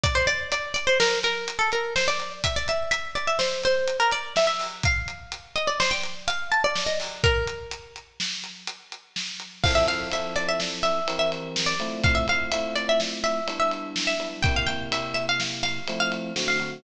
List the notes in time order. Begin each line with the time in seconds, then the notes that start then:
0.04 D5, kick, closed hi-hat
0.15 C5
0.27 D5, closed hi-hat
0.52 D5, closed hi-hat
0.74 D5, closed hi-hat
0.87 C5
1.00 A#4, snare
1.23 A#4, closed hi-hat
1.48 closed hi-hat
1.59 A4
1.72 A#4, closed hi-hat
1.96 C5, snare
2.08 D5
2.20 closed hi-hat
2.44 E5, kick, closed hi-hat
2.56 D5
2.68 E5, closed hi-hat
2.91 E5, closed hi-hat
3.15 D5, closed hi-hat
3.27 E5
3.39 C5, snare
3.63 C5, closed hi-hat
3.88 closed hi-hat
4.00 A#4
4.11 D5, closed hi-hat
4.36 E5, snare
4.47 E5
4.59 open hi-hat
4.83 F5, kick, closed hi-hat
5.08 closed hi-hat
5.32 closed hi-hat
5.56 D#5, closed hi-hat
5.67 D5
5.80 C5, snare
5.91 G5
6.03 closed hi-hat
6.28 F5, closed hi-hat
6.52 A5, closed hi-hat
6.64 D5
6.75 snare
6.86 D#5
7.00 open hi-hat
7.24 A#4, kick, closed hi-hat
7.47 closed hi-hat
7.71 closed hi-hat
7.96 closed hi-hat
8.20 snare
8.44 closed hi-hat
8.67 closed hi-hat
8.92 closed hi-hat
9.16 snare
9.40 closed hi-hat
9.64 F3 C4 E4 A4 F5, kick, crash
9.75 E5
9.87 F3 C4 E4 A4 F5, ride
10.11 F3 C4 E4 A4 E5, ride
10.36 D5, ride
10.48 E5
10.60 snare
10.83 E5, ride
11.08 E3 C4 G4 A#4, ride
11.19 E5
11.32 ride
11.56 snare
11.66 D5
11.80 A3 C4 E4 F4, ride
12.04 F5, kick, ride
12.15 E5
12.28 A3 C4 E4 F4 F5, ride
12.52 A3 C4 E4 F4 E5, ride
12.76 D5, ride
12.89 E5
13.00 snare
13.24 E5, ride
13.47 G3 B3 D4 E4, ride
13.60 E5
13.71 ride
13.96 snare
14.07 E5
14.20 G3 B3 D4 E4, ride
14.43 C3 A#3 E4 G4 G5, kick, ride
14.56 F5
14.67 C3 A#3 E4 G4 G5, ride
14.91 C3 A#3 E4 G4 E5, ride
15.14 E5, ride
15.29 F5
15.40 snare
15.63 F5, ride
15.88 F3 A3 C4 E4, ride
16.00 F5
16.12 ride
16.36 D3 A3 C4 F#4, snare
16.48 F5
16.60 D3 A3 C4 F#4, ride